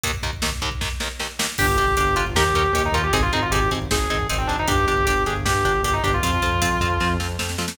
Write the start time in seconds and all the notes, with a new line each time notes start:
0.03 D#2 D#3 A#3, kick, closed hi-hat
0.14 kick
0.23 D#2 D#3 A#3, kick, closed hi-hat
0.33 kick
0.42 D#2 D#3 A#3, kick, snare
0.52 kick
0.62 D#2 D#3 A#3, kick, closed hi-hat
0.71 kick
0.81 D#2 D#3 A#3, kick, snare
1.00 D#2 D#3 A#3, snare
1.19 D#2 D#3 A#3, snare
1.39 D#2 D#3 A#3, snare
1.58 G1 D4 G4, kick, crash
1.68 kick
1.77 G1 D4 G4, kick, closed hi-hat
1.88 kick
1.97 G1 D4 G4, kick, closed hi-hat
2.07 kick
2.16 G1 D4 F4 G4, kick, closed hi-hat
2.26 kick
2.35 D#2 C#4 D#4 G4 A#4, kick, snare
2.46 kick
2.53 D#2 C#4 D#4 G4 A#4, kick, closed hi-hat
2.64 kick
2.73 D#2 C#4 D#4 G4 A#4, kick, closed hi-hat
2.84 D#4, kick
2.92 D#2 C#4 D#4 F4 G4 A#4, kick, closed hi-hat
3.03 G4, kick
3.13 G#1 C4 D#4 G#4, kick, closed hi-hat
3.22 F4, kick
3.32 G#1 C4 D#4 G#4, kick, closed hi-hat
3.42 F4, kick
3.51 G#1 C4 D#4 G4 G#4, kick, closed hi-hat
3.61 kick
3.71 G#1 C4 D#4 G#4, kick, closed hi-hat
3.82 kick
3.91 G#1 C4 D#4 G#4, kick, snare
4.00 kick
4.10 G#1 C4 D#4 G#4, kick, closed hi-hat
4.20 kick
4.29 G#1 C4 D#4 G#4, kick, closed hi-hat
4.38 C4, kick
4.47 G#1 C4 D4 D#4 G#4, kick, closed hi-hat
4.59 D#4, kick
4.68 G1 D4 G4, kick, closed hi-hat
4.78 kick
4.87 G1 D4 G4, kick, closed hi-hat
4.97 kick
5.05 G1 D4 G4, kick, closed hi-hat
5.16 kick
5.26 G1 D4 G4 G#4, kick, closed hi-hat
5.36 kick
5.45 G1 D4 G4, kick, snare
5.55 kick
5.64 G1 D4 G4, kick, closed hi-hat
5.75 kick
5.82 G1 D4 G4, kick, closed hi-hat
5.93 D#4, kick
6.03 G1 D4 G4, kick, closed hi-hat
6.13 F4, kick
6.23 F2 C4 F4, kick, closed hi-hat
6.33 kick
6.42 F2 C4 F4, kick, closed hi-hat
6.52 kick
6.62 F2 C4 F4, kick, closed hi-hat
6.72 kick
6.81 F2 C4 F4, kick, closed hi-hat
6.90 kick
7.00 F2 C4 F4, kick, snare
7.20 F2 C4 F4, snare
7.39 F2 C4 F4, snare
7.49 snare
7.58 F2 C4 F4, snare
7.68 snare